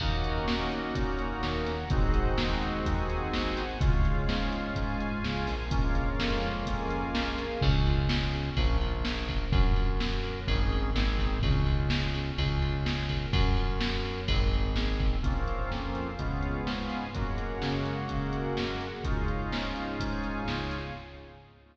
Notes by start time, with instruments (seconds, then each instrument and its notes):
0.00 synth bass 1 D#2, drawbar organ A#3 C#4 D#4 F#4, string ensemble 1 A#4 C#5 D#5 F#5, kick, crash
0.24 closed hi-hat
0.47 synth bass 1 A#2, snare
0.72 closed hi-hat
0.95 synth bass 1 A#2, string ensemble 1 A#4 C#5 F#5 A#5, kick, closed hi-hat
1.19 closed hi-hat
1.43 synth bass 1 D#2, snare
1.66 snare, closed hi-hat
1.90 synth bass 1 G#1, drawbar organ G#3 C4 D#4 F#4, string ensemble 1 G#4 C5 D#5 F#5, kick, closed hi-hat
2.14 kick, closed hi-hat
2.38 synth bass 1 D#2, snare
2.63 closed hi-hat
2.86 synth bass 1 D#2, string ensemble 1 G#4 C5 F#5 G#5, kick, closed hi-hat
3.10 closed hi-hat
3.33 synth bass 1 G#1, snare
3.57 snare, closed hi-hat
3.81 synth bass 1 C#2, drawbar organ G#3 C#4 F4, string ensemble 1 G#4 C#5 F5, kick, closed hi-hat
4.05 closed hi-hat
4.29 synth bass 1 G#2, snare
4.52 closed hi-hat
4.75 synth bass 1 G#2, string ensemble 1 G#4 F5 G#5, kick, closed hi-hat
5.00 closed hi-hat
5.24 synth bass 1 C#2, snare
5.47 synth bass 1 A#1, snare, open hi-hat
5.71 drawbar organ G#3 A#3 C#4 F4, string ensemble 1 G#4 A#4 C#5 F5, kick, closed hi-hat
5.95 kick, closed hi-hat
6.19 synth bass 1 F2, snare
6.42 closed hi-hat
6.66 synth bass 1 F2, string ensemble 1 G#4 A#4 F5 G#5, kick, closed hi-hat
6.90 closed hi-hat
7.14 synth bass 1 A#1, snare
7.38 snare, closed hi-hat
7.61 synth bass 1 C#2, drawbar organ C#4, kick, crash
7.86 drawbar organ F4, ride
8.09 drawbar organ G#4, snare
8.32 drawbar organ C#4, ride
8.56 synth bass 1 A#1, drawbar organ C#4, kick, ride
8.81 drawbar organ F4, ride
9.04 drawbar organ G#4, snare
9.28 drawbar organ A#4, kick, ride
9.52 synth bass 1 F#2, drawbar organ C#4, kick, ride
9.76 drawbar organ F4, ride
10.00 drawbar organ F#4, snare
10.24 drawbar organ A#4, ride
10.47 synth bass 1 G#1, drawbar organ C#4 D#4 G#4, kick, ride
10.72 ride
10.95 synth bass 1 G#1, drawbar organ C4 D#4 G#4, snare
11.18 kick, ride
11.43 synth bass 1 C#2, drawbar organ C#4, kick, ride
11.66 drawbar organ F4, ride
11.90 drawbar organ G#4, snare
12.14 drawbar organ C#4, ride
12.37 synth bass 1 C#2, drawbar organ C#4, kick, ride
12.61 drawbar organ F4, ride
12.85 drawbar organ G#4, snare
13.09 drawbar organ A#4, kick, ride
13.33 synth bass 1 F#2, drawbar organ C#4, kick, ride
13.57 drawbar organ F4, ride
13.81 drawbar organ F#4, snare
14.04 drawbar organ A#4, ride
14.28 synth bass 1 G#1, drawbar organ C4, kick, ride
14.52 drawbar organ D#4, ride
14.76 drawbar organ G#4, snare
15.00 drawbar organ C4, kick, ride
15.23 synth bass 1 A#1, drawbar organ A#3 C4 C#4 F4, string ensemble 1 A#4 C5 C#5 F5, kick, closed hi-hat
15.48 closed hi-hat
15.71 synth bass 1 F2, string ensemble 1 F4 A#4 C5 F5, snare
15.95 closed hi-hat
16.19 synth bass 1 C#2, drawbar organ G#3 B3 C#4 F4, string ensemble 1 G#4 B4 C#5 F5, kick, closed hi-hat
16.42 closed hi-hat
16.67 synth bass 1 G#2, string ensemble 1 G#4 B4 F5 G#5, snare
16.90 snare, closed hi-hat
17.14 synth bass 1 F#2, drawbar organ G#3 A#3 C#4 F#4, string ensemble 1 G#4 A#4 C#5 F#5, kick, closed hi-hat
17.38 closed hi-hat
17.62 synth bass 1 C#3, snare
17.85 closed hi-hat
18.09 synth bass 1 C#3, string ensemble 1 F#4 G#4 A#4 F#5, kick, closed hi-hat
18.33 closed hi-hat
18.57 synth bass 1 F#2, snare
18.81 snare, closed hi-hat
19.04 synth bass 1 C#2, drawbar organ G#3 C#4 D#4 F4, string ensemble 1 G#4 C#5 D#5 F5, kick, closed hi-hat
19.28 closed hi-hat
19.52 synth bass 1 G#2, snare
19.76 closed hi-hat
19.99 synth bass 1 G#2, string ensemble 1 G#4 C#5 F5 G#5, kick, closed hi-hat
20.24 closed hi-hat
20.48 synth bass 1 C#2, snare
20.71 snare, closed hi-hat